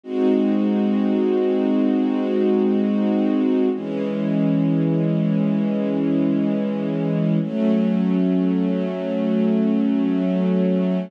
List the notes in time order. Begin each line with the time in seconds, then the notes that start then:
0.03 G#3 C4 D#4 F#4
3.73 E3 G#3 C#4
7.42 F#3 A3 C#4